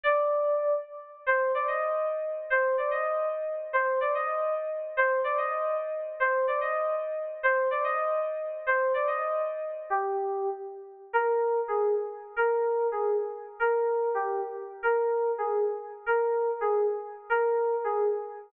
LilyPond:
\new Staff { \time 9/8 \key c \minor \tempo 4. = 146 d''2. r4. | c''4 d''8 ees''4. r4. | c''4 d''8 ees''4. r4. | c''4 d''8 ees''4. r4. |
c''4 d''8 ees''4. r4. | c''4 d''8 ees''4. r4. | c''4 d''8 ees''4. r4. | c''4 d''8 ees''4. r4. |
g'2~ g'8 r2 | \key ees \major bes'2 aes'4 r4. | bes'2 aes'4 r4. | bes'2 g'4 r4. |
bes'2 aes'4 r4. | bes'2 aes'4 r4. | bes'2 aes'4 r4. | }